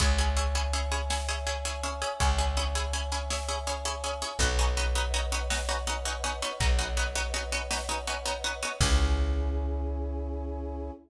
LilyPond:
<<
  \new Staff \with { instrumentName = "Pizzicato Strings" } { \time 12/8 \key cis \minor \tempo 4. = 109 <cis' e' gis'>8 <cis' e' gis'>8 <cis' e' gis'>8 <cis' e' gis'>8 <cis' e' gis'>8 <cis' e' gis'>8 <cis' e' gis'>8 <cis' e' gis'>8 <cis' e' gis'>8 <cis' e' gis'>8 <cis' e' gis'>8 <cis' e' gis'>8 | <cis' e' gis'>8 <cis' e' gis'>8 <cis' e' gis'>8 <cis' e' gis'>8 <cis' e' gis'>8 <cis' e' gis'>8 <cis' e' gis'>8 <cis' e' gis'>8 <cis' e' gis'>8 <cis' e' gis'>8 <cis' e' gis'>8 <cis' e' gis'>8 | <b cis' dis' fis'>8 <b cis' dis' fis'>8 <b cis' dis' fis'>8 <b cis' dis' fis'>8 <b cis' dis' fis'>8 <b cis' dis' fis'>8 <b cis' dis' fis'>8 <b cis' dis' fis'>8 <b cis' dis' fis'>8 <b cis' dis' fis'>8 <b cis' dis' fis'>8 <b cis' dis' fis'>8 | <b cis' dis' fis'>8 <b cis' dis' fis'>8 <b cis' dis' fis'>8 <b cis' dis' fis'>8 <b cis' dis' fis'>8 <b cis' dis' fis'>8 <b cis' dis' fis'>8 <b cis' dis' fis'>8 <b cis' dis' fis'>8 <b cis' dis' fis'>8 <b cis' dis' fis'>8 <b cis' dis' fis'>8 |
<cis' e' gis'>1. | }
  \new Staff \with { instrumentName = "Electric Bass (finger)" } { \clef bass \time 12/8 \key cis \minor cis,1. | cis,1. | b,,1. | b,,1. |
cis,1. | }
  \new Staff \with { instrumentName = "Brass Section" } { \time 12/8 \key cis \minor <cis'' e'' gis''>1.~ | <cis'' e'' gis''>1. | <b' cis'' dis'' fis''>1.~ | <b' cis'' dis'' fis''>1. |
<cis' e' gis'>1. | }
  \new DrumStaff \with { instrumentName = "Drums" } \drummode { \time 12/8 <hh bd>8 hh8 hh8 hh8 hh8 hh8 sn8 hh8 hh8 hh8 hh8 hh8 | <hh bd>8 hh8 hh8 hh8 hh8 hh8 sn8 hh8 hh8 hh8 hh8 hh8 | <hh bd>8 hh8 hh8 hh8 hh8 hh8 sn8 hh8 hh8 hh8 hh8 hh8 | <hh bd>8 hh8 hh8 hh8 hh8 hh8 sn8 hh8 hh8 hh8 hh8 hh8 |
<cymc bd>4. r4. r4. r4. | }
>>